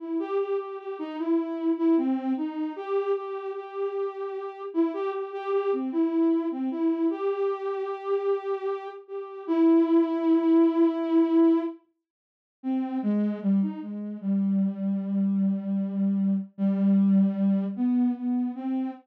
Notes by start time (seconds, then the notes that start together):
0.00 E4
0.20 G4
0.39 G4
0.59 G4
0.79 G4
0.99 D#4
1.18 E4
1.77 E4
1.97 C4
2.37 D#4
2.76 G4
3.16 G4
3.55 G4
4.74 E4
4.94 G4
5.13 G4
5.33 G4
5.53 G4
5.73 C4
5.92 E4
6.51 C4
6.71 E4
7.10 G4
9.08 G4
9.47 E4
12.63 C4
13.03 G#3
13.42 G3
13.62 D#4
13.82 G#3
14.21 G3
16.58 G3
17.76 B3
18.16 B3
18.55 C4